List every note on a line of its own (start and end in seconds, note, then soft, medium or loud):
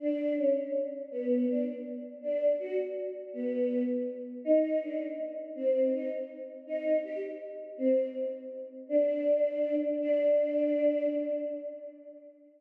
0.00 0.33 D4 medium
0.37 0.54 C#4 medium
1.11 1.46 B3 medium
1.48 1.64 D4 medium
2.22 2.53 D4 medium
2.59 2.76 F#4 medium
3.33 3.83 B3 medium
4.45 4.78 D#4 medium
4.81 4.99 D4 medium
5.55 5.90 C4 medium
5.93 6.08 D#4 medium
6.67 6.97 D#4 medium
7.04 7.20 G4 medium
7.78 8.06 C4 medium
8.89 9.75 D4 medium
10.00 11.06 D4 loud